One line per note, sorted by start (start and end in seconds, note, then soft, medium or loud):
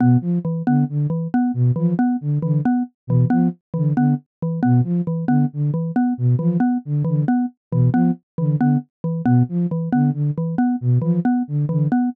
0.00 0.17 B2 medium
0.00 0.18 B3 medium
0.21 0.39 F3 medium
0.45 0.62 E3 medium
0.67 0.84 D3 medium
0.67 0.85 B3 medium
0.89 1.07 D3 medium
1.10 1.28 E3 medium
1.34 1.52 B3 medium
1.54 1.72 B2 medium
1.76 1.94 E3 medium
1.76 1.94 F3 medium
1.99 2.17 B3 medium
2.21 2.39 D3 medium
2.42 2.61 D3 medium
2.42 2.60 E3 medium
2.65 2.83 B3 medium
3.07 3.25 B2 medium
3.07 3.28 E3 medium
3.30 3.49 F3 medium
3.30 3.48 B3 medium
3.74 3.93 D3 medium
3.74 3.91 E3 medium
3.97 4.14 D3 medium
3.97 4.15 B3 medium
4.42 4.60 E3 medium
4.63 4.82 B2 medium
4.63 4.80 B3 medium
4.84 5.01 F3 medium
5.07 5.25 E3 medium
5.28 5.45 D3 medium
5.28 5.46 B3 medium
5.53 5.71 D3 medium
5.74 5.91 E3 medium
5.96 6.14 B3 medium
6.18 6.35 B2 medium
6.39 6.57 E3 medium
6.39 6.57 F3 medium
6.60 6.78 B3 medium
6.85 7.03 D3 medium
7.05 7.24 D3 medium
7.05 7.22 E3 medium
7.28 7.46 B3 medium
7.72 7.89 B2 medium
7.72 7.90 E3 medium
7.93 8.11 F3 medium
7.93 8.11 B3 medium
8.38 8.56 D3 medium
8.38 8.56 E3 medium
8.59 8.77 D3 medium
8.59 8.78 B3 medium
9.04 9.22 E3 medium
9.25 9.43 B2 medium
9.25 9.43 B3 medium
9.49 9.66 F3 medium
9.71 9.89 E3 medium
9.92 10.11 D3 medium
9.92 10.10 B3 medium
10.13 10.31 D3 medium
10.38 10.55 E3 medium
10.58 10.76 B3 medium
10.81 10.99 B2 medium
11.02 11.19 E3 medium
11.02 11.20 F3 medium
11.25 11.43 B3 medium
11.48 11.65 D3 medium
11.69 11.88 D3 medium
11.69 11.87 E3 medium
11.92 12.09 B3 medium